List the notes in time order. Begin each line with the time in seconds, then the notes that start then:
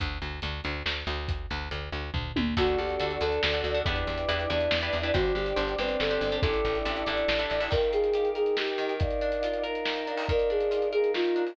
0.00 D2, kick, closed hi-hat
0.22 D2, closed hi-hat
0.42 D2, closed hi-hat
0.64 D2, closed hi-hat
0.86 D2, snare
1.07 D2, closed hi-hat
1.28 kick, closed hi-hat
1.50 D2, closed hi-hat
1.71 D2, closed hi-hat
1.92 D2, closed hi-hat
2.14 D2, kick, floor tom
2.36 D2, high tom
2.57 D2 D4 F#4 A4, kick, crash
2.67 closed hi-hat
2.78 D2 G4
2.89 closed hi-hat
3.00 D2 D4 F#4 A4, closed hi-hat
3.11 closed hi-hat
3.21 D2 D4 F#4 A4 D5, closed hi-hat
3.32 closed hi-hat
3.43 D2 A4, snare
3.53 D4 F#4 A4, closed hi-hat
3.64 D2, closed hi-hat
3.74 D4 F#4 A4, closed hi-hat
3.86 E2 D4 E4 G4 B4, kick, closed hi-hat
3.96 closed hi-hat
4.07 E2, closed hi-hat
4.18 closed hi-hat
4.28 E2 D4 E4 G4 B4, closed hi-hat
4.39 closed hi-hat
4.49 E2 D4 E4 G4 B4 D5, closed hi-hat
4.61 closed hi-hat
4.71 E2, snare
4.81 D4 E4 G4 B4, closed hi-hat
4.93 E2, closed hi-hat
5.03 D4 E4 G4 B4, closed hi-hat
5.13 G1 D4 F#4 G4 C5, kick, closed hi-hat
5.25 closed hi-hat
5.35 G1 G4, closed hi-hat
5.46 closed hi-hat
5.56 G1 D4 G4 C5, closed hi-hat
5.68 closed hi-hat
5.78 G1 C4 D4 G4 B4 C5, closed hi-hat
5.89 closed hi-hat
6.00 G1 A4, snare
6.11 D4 G4 C5, closed hi-hat
6.21 G1, closed hi-hat
6.32 D4 G4 C5, closed hi-hat
6.41 A1 D4 E4 G4 A4, kick, closed hi-hat
6.54 closed hi-hat
6.65 A1, closed hi-hat
6.75 closed hi-hat
6.85 A1 D4 E4 G4 A4, closed hi-hat
6.96 closed hi-hat
7.06 A1 D4 E4 G4 A4 D5, closed hi-hat
7.17 closed hi-hat
7.28 A1, snare
7.39 D4 E4 G4 A4, closed hi-hat
7.50 A1, closed hi-hat
7.60 D4 E4 G4 A4, open hi-hat
7.71 D#3 D#4 A#4 F5 G5, kick, crash
7.83 closed hi-hat
7.93 F4 G#4, closed hi-hat
8.04 closed hi-hat
8.13 G4, closed hi-hat
8.25 closed hi-hat
8.35 D#4 G#4 A#4 D#5 G5, closed hi-hat
8.46 closed hi-hat
8.57 D#3 G4, snare
8.68 closed hi-hat
8.78 D#3, closed hi-hat
8.89 closed hi-hat
8.99 D#4 A#4 D5 F5, kick, closed hi-hat
9.11 closed hi-hat
9.21 D4, closed hi-hat
9.32 closed hi-hat
9.43 F4, closed hi-hat
9.53 closed hi-hat
9.63 D#4 A#4 F5 A#5, closed hi-hat
9.75 closed hi-hat
9.85 D#3, snare
9.96 closed hi-hat
10.07 D4, closed hi-hat
10.17 open hi-hat
10.28 D#3 D#4 A#4 D5 F5, kick, closed hi-hat
10.39 closed hi-hat
10.50 D4 G#4, closed hi-hat
10.60 closed hi-hat
10.71 F4, closed hi-hat
10.82 closed hi-hat
10.92 D#4 G#4 A#4 F5 A#5, closed hi-hat
11.04 closed hi-hat
11.14 D#3 F4, snare
11.24 closed hi-hat
11.36 D4, closed hi-hat
11.47 open hi-hat